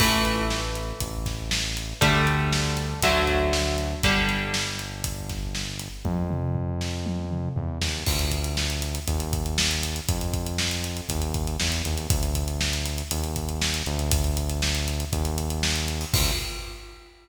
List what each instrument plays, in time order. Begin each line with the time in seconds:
0.00 synth bass 1 A1, overdriven guitar E3 A3, kick, crash
0.25 closed hi-hat
0.50 snare
0.75 closed hi-hat
1.00 synth bass 1 A1, kick, closed hi-hat
1.26 kick, snare, closed hi-hat
1.51 snare
1.77 closed hi-hat
2.01 synth bass 1 D2, overdriven guitar D3 G3 A3, kick, closed hi-hat
2.27 closed hi-hat
2.53 snare
2.77 closed hi-hat
3.02 synth bass 1 D2, overdriven guitar D3 F#3 A3, kick, closed hi-hat
3.27 kick, snare, closed hi-hat
3.53 snare
3.78 closed hi-hat
4.03 synth bass 1 G1, overdriven guitar D3 G3, kick, closed hi-hat
4.29 closed hi-hat
4.54 snare
4.79 closed hi-hat
5.04 kick, closed hi-hat
5.29 kick, snare, closed hi-hat
5.55 snare
5.79 closed hi-hat
6.05 synth bass 1 F2, kick, high tom
6.30 mid tom
6.55 floor tom
6.81 snare
7.06 high tom
7.31 mid tom
7.56 synth bass 1 E2, floor tom
7.82 synth bass 1 D#2, snare
8.07 synth bass 1 D2, kick, crash
8.19 closed hi-hat
8.32 kick, closed hi-hat
8.44 closed hi-hat
8.57 snare
8.70 closed hi-hat
8.82 closed hi-hat
8.95 closed hi-hat
9.07 synth bass 1 D#2, kick, closed hi-hat
9.20 closed hi-hat
9.33 kick, closed hi-hat
9.46 closed hi-hat
9.58 snare
9.71 closed hi-hat
9.83 closed hi-hat
9.96 closed hi-hat
10.08 synth bass 1 F2, kick, closed hi-hat
10.21 closed hi-hat
10.34 kick, closed hi-hat
10.46 closed hi-hat
10.58 snare
10.71 closed hi-hat
10.84 closed hi-hat
10.97 closed hi-hat
11.09 synth bass 1 D#2, kick, closed hi-hat
11.22 closed hi-hat
11.34 kick, closed hi-hat
11.47 closed hi-hat
11.60 synth bass 1 E2, snare
11.72 closed hi-hat
11.85 synth bass 1 D#2, closed hi-hat
11.97 closed hi-hat
12.10 synth bass 1 D2, kick, closed hi-hat
12.23 closed hi-hat
12.35 kick, closed hi-hat
12.48 closed hi-hat
12.61 snare
12.73 closed hi-hat
12.86 closed hi-hat
12.98 closed hi-hat
13.11 synth bass 1 D#2, closed hi-hat
13.24 closed hi-hat
13.36 kick, closed hi-hat
13.49 closed hi-hat
13.61 snare
13.74 closed hi-hat
13.86 synth bass 1 D2, closed hi-hat
13.99 closed hi-hat
14.11 kick, closed hi-hat
14.24 closed hi-hat
14.37 closed hi-hat
14.49 closed hi-hat
14.62 snare
14.75 closed hi-hat
14.88 closed hi-hat
15.00 closed hi-hat
15.13 synth bass 1 D#2, kick, closed hi-hat
15.25 closed hi-hat
15.38 closed hi-hat
15.50 closed hi-hat
15.63 snare
15.76 closed hi-hat
15.88 closed hi-hat
16.01 open hi-hat
16.13 synth bass 1 D2, kick, crash